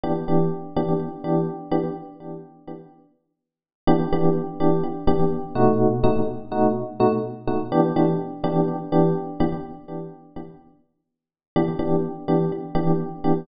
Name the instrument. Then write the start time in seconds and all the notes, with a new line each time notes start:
electric piano 1
0.04 E3 B3 D4 G4
0.28 E3 B3 D4 G4
0.76 E3 B3 D4 G4
1.24 E3 B3 D4 G4
1.71 E3 B3 D4 G4
3.87 E3 B3 D4 G4
4.12 E3 B3 D4 G4
4.60 E3 B3 D4 G4
5.07 E3 B3 D4 G4
5.55 B2 A3 D#4 F#4
6.04 B2 A3 D#4 F#4
6.52 B2 A3 D#4 F#4
7.00 B2 A3 D#4 F#4
7.47 B2 A3 D#4 F#4
7.72 E3 B3 D4 G4
7.96 E3 B3 D4 G4
8.44 E3 B3 D4 G4
8.92 E3 B3 D4 G4
9.40 E3 B3 D4 G4
11.56 E3 B3 D4 G4
11.79 E3 B3 D4 G4
12.28 E3 B3 D4 G4
12.75 E3 B3 D4 G4
13.24 E3 B3 D4 G4